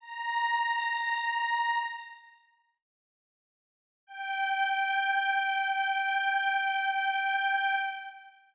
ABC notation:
X:1
M:4/4
L:1/8
Q:1/4=59
K:Gdor
V:1 name="Pad 5 (bowed)"
b4 z4 | g8 |]